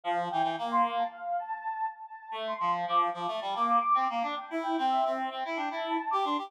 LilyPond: <<
  \new Staff \with { instrumentName = "Ocarina" } { \time 4/4 \key c \mixolydian \tempo 4 = 111 f''16 r16 g''8 r16 c'''8 a''16 f''8 a''16 a''8. r16 a''16 | a''16 r16 c'''8 r16 d'''8 d'''16 a''8 d'''16 d'''8. r16 d'''16 | g''16 r16 g''8 e''8 r8. g''16 a''8 a''16 d'''16 c'''16 d'''16 | }
  \new Staff \with { instrumentName = "Clarinet" } { \time 4/4 \key c \mixolydian f8 e16 e16 bes4 r2 | r16 a8 f8 f8 f16 a16 g16 bes8 r16 c'16 bes16 d'16 | r16 e'8 c'8 c'8 c'16 e'16 d'16 e'8 r16 g'16 d'16 g'16 | }
>>